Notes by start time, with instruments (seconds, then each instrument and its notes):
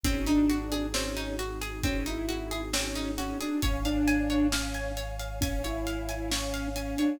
0.04 synth bass 2 G#1, pizzicato strings C4, pad 2 (warm) C4 D#4 F#4 G#4, ocarina C#4, kick, closed hi-hat
0.27 ocarina D4, pizzicato strings D#4, closed hi-hat
0.50 pizzicato strings F#4, closed hi-hat
0.72 pizzicato strings G#4, closed hi-hat
0.93 pizzicato strings C4, ocarina C#4, snare
1.17 pizzicato strings D#4, closed hi-hat
1.39 pizzicato strings F#4, closed hi-hat
1.61 pizzicato strings G#4, closed hi-hat
1.83 pizzicato strings C4, ocarina C#4, kick, closed hi-hat
2.06 pizzicato strings D#4, ocarina E4, closed hi-hat
2.29 pizzicato strings F#4, closed hi-hat
2.51 pizzicato strings G#4, closed hi-hat
2.73 pizzicato strings C4, ocarina C#4, snare
2.96 pizzicato strings D#4, closed hi-hat
3.18 ocarina C#4, pizzicato strings F#4, closed hi-hat
3.41 ocarina D4, pizzicato strings G#4, closed hi-hat
3.62 synth bass 2 G#1, ocarina C#4, pad 2 (warm) C#5 F5 G#5, pizzicato strings C#5, kick, closed hi-hat
3.85 ocarina D4, pizzicato strings F5, closed hi-hat
4.08 pizzicato strings G#5, closed hi-hat
4.30 pizzicato strings C#5, closed hi-hat
4.52 ocarina C#4, pizzicato strings F5, snare
4.74 pizzicato strings G#5, closed hi-hat
4.97 pizzicato strings C#5, closed hi-hat
5.19 pizzicato strings F5, closed hi-hat
5.41 ocarina C#4, pizzicato strings G#5, kick, closed hi-hat
5.64 ocarina E4, pizzicato strings C#5, closed hi-hat
5.87 pizzicato strings F5, closed hi-hat
6.09 pizzicato strings G#5, closed hi-hat
6.31 ocarina C#4, pizzicato strings C#5, snare
6.54 pizzicato strings F5, closed hi-hat
6.75 ocarina C#4, pizzicato strings G#5, closed hi-hat
6.98 ocarina D4, pizzicato strings C#5, closed hi-hat